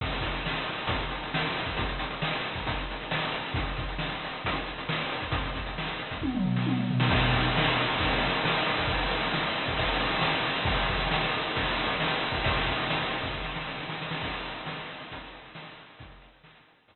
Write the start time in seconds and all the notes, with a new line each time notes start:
0.01 kick, crash
0.12 closed hi-hat
0.21 kick, closed hi-hat
0.34 closed hi-hat
0.46 snare
0.55 closed hi-hat
0.65 closed hi-hat
0.77 closed hi-hat
0.87 kick, closed hi-hat
1.00 closed hi-hat
1.11 closed hi-hat
1.23 closed hi-hat
1.34 snare
1.45 closed hi-hat
1.57 closed hi-hat
1.66 kick, open hi-hat
1.77 kick, closed hi-hat
1.89 closed hi-hat
1.99 closed hi-hat
2.11 closed hi-hat
2.22 snare
2.33 closed hi-hat
2.45 closed hi-hat
2.55 kick, closed hi-hat
2.67 kick, closed hi-hat
2.77 closed hi-hat
2.91 closed hi-hat
3.01 closed hi-hat
3.11 snare
3.22 closed hi-hat
3.32 closed hi-hat
3.45 closed hi-hat
3.54 kick, closed hi-hat
3.66 closed hi-hat
3.77 kick, closed hi-hat
3.88 closed hi-hat
3.98 snare
4.09 closed hi-hat
4.24 closed hi-hat
4.33 closed hi-hat
4.45 kick, closed hi-hat
4.56 closed hi-hat
4.66 closed hi-hat
4.78 closed hi-hat
4.89 snare
5.01 closed hi-hat
5.12 closed hi-hat
5.22 kick, closed hi-hat
5.32 kick, closed hi-hat
5.46 closed hi-hat
5.55 kick, closed hi-hat
5.66 closed hi-hat
5.78 snare
5.87 closed hi-hat
5.99 closed hi-hat
6.11 kick, closed hi-hat
6.21 kick, high tom
6.34 mid tom
6.44 floor tom
6.56 snare
6.66 high tom
6.78 mid tom
6.90 floor tom
7.00 snare
7.10 kick, crash
7.23 ride
7.33 kick, ride
7.44 ride
7.57 snare
7.66 ride
7.77 ride
7.89 ride
8.00 kick, ride
8.11 ride
8.23 ride
8.33 ride
8.45 snare
8.56 ride
8.66 ride
8.78 kick, ride
8.88 kick, ride
9.01 ride
9.09 ride
9.23 ride
9.33 snare
9.44 ride
9.56 ride
9.66 kick, ride
9.77 kick, ride
9.87 ride
9.99 ride
10.12 ride
10.21 snare
10.34 ride
10.45 ride
10.56 ride
10.65 kick, ride
10.78 ride
10.89 kick, ride
11.00 ride
11.11 snare
11.22 ride
11.32 ride
11.45 ride
11.56 kick, ride
11.67 ride
11.77 ride
11.89 ride
12.00 snare
12.11 ride
12.22 ride
12.32 kick, ride
12.44 kick, ride
12.56 ride
12.67 kick, ride
12.78 ride
12.90 snare
13.00 ride
13.11 ride
13.21 kick, ride
13.34 kick
13.44 snare
13.56 snare
13.66 snare
13.78 snare
13.89 snare
14.02 snare
14.11 snare
14.21 kick, crash
14.32 closed hi-hat
14.45 closed hi-hat
14.55 closed hi-hat
14.66 snare
14.78 closed hi-hat
14.89 closed hi-hat
14.99 closed hi-hat
15.12 kick, closed hi-hat
15.23 closed hi-hat
15.32 closed hi-hat
15.45 closed hi-hat
15.55 snare
15.66 closed hi-hat
15.78 closed hi-hat
15.90 closed hi-hat
15.99 kick, closed hi-hat
16.10 closed hi-hat
16.22 closed hi-hat
16.34 closed hi-hat
16.44 snare
16.55 closed hi-hat
16.67 closed hi-hat
16.78 closed hi-hat
16.88 kick, closed hi-hat